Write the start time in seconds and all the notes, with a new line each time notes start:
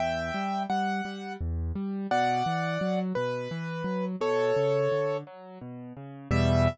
0.00 E2 E5 G5
0.34 G3
0.70 G3 F#5
1.05 G3
1.40 E2
1.75 G3
2.11 B2 D5 F#5
2.46 E3
2.81 F#3
3.15 B2 B4
3.51 E3
3.84 F#3
4.20 B2 A4 C#5
4.56 C#3
4.92 D3
5.27 F#3
5.61 B2
5.97 C#3
6.31 E2 B2 G3 E5